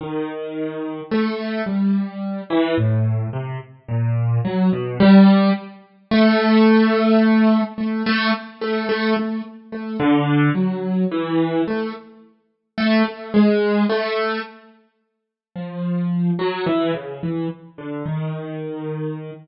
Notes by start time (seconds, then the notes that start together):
0.01 D#3
1.11 A3
1.66 G3
2.50 E3
2.78 A2
3.33 C3
3.88 A#2
4.45 F#3
4.73 B2
5.00 G3
6.11 A3
7.78 A3
8.06 A3
8.61 A3
8.89 A3
9.17 A3
9.72 A3
10.00 D3
10.55 F#3
11.12 E3
11.68 A3
12.78 A3
13.05 A3
13.34 G#3
13.89 A3
15.56 F3
16.39 F#3
16.66 E3
16.94 C#3
17.23 E3
17.78 D3
18.06 D#3